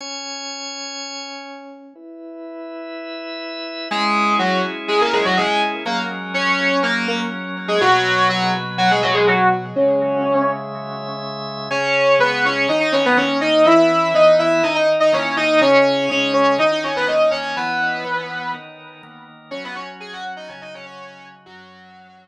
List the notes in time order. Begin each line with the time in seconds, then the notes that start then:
0.01 C#4 C#5 G#5
1.95 E4 B4 E5
3.91 G#3 C#4 E4 G#4
4.39 F#3 F#4
4.88 G#3 G#4
5.01 A#3 A#4
5.13 G#3 G#4
5.25 F#3 F#4
5.37 G#3 G#4
5.85 F#3 A#3 C#4 A#4
6.34 C#4 C#5
6.83 A#3 A#4
7.08 A#3 A#4
7.68 G#3 G#4
7.80 B2 F#3 F#4 B4
8.29 F#3 F#4
8.78 F#3 F#4
8.91 G#3 G#4
9.02 F#3 F#4
9.14 G#3 G#4
9.27 F#3 F#4
9.76 C#3 G#3 C#4 C#5 E5
11.71 C#3 C#4 G#4 C#5
12.19 C#3 G#3 B3 G#4 B4
12.45 C#4 C#5
12.68 D#3 D#4 A#4 D#5
12.80 D#4 D#5
12.92 C#4 C#5
13.05 B3 B4
13.17 D#3 A#3 C#4 A#4 C#5
13.41 D#4 D#5
13.65 E3 E4 B4 E5
14.14 E3 B3 D#4 B4 D#5
14.39 E4 E5
14.63 D#3 D#4 A#4 D#5
14.75 D#4 D#5
15.00 D#4 D#5
15.12 D#3 A#3 C#4 A#4 C#5
15.37 D#4 D#5
15.61 C#3 C#4 G#4 C#5
16.09 C#3 G#3 C#4 G#4 C#5
16.33 C#4 C#5
16.58 D#3 D#4 A#4 D#5
16.71 D#4 D#5
16.84 C#4 C#5
16.96 B3 B4
17.07 D#3 A#3 D#4 A#4 D#5
17.31 C#4 C#5
17.56 E3 B3 E4 B4
18.05 E3 B3 B4
18.54 D#3 D#4 A#4
19.03 D#3 A#3 A#4
19.51 F#3 C#4 F#4 C#5
19.64 B3 B4
19.75 C#4 C#5
20.00 G#4 G#5
20.13 F#4 F#5
20.36 D#4 D#5
20.48 C#3 F#3 C#4 F#4 C#5
20.61 D#4 D#5
20.74 C#4 C#5
20.85 C#4 C#5
21.46 F#2 F#3 C#4 F#4